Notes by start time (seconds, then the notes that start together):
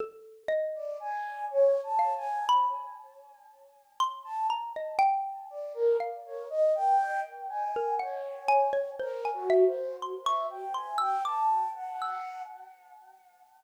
0.00 A4
0.48 D#5
0.75 D5
1.00 G#5
1.51 C#5
1.83 A5
1.99 F5
2.17 G#5
2.49 B5
4.00 C6
4.24 A5
4.50 A#5
4.76 D#5
4.99 G5
5.50 D5
5.74 A#4
6.00 F5
6.26 C#5
6.50 D#5
6.75 G5
7.49 G#5
7.76 A#4
7.99 C#5 F#5
8.48 G#5
8.73 C#5
8.99 A#4 C5
9.25 G#5
9.34 F#4
9.50 E5
9.66 C5
10.02 C6
10.24 E5 C#6
10.50 G5
10.74 G#5 C6
10.98 G5 E6
11.25 A5 D6
11.75 F#5
12.01 E6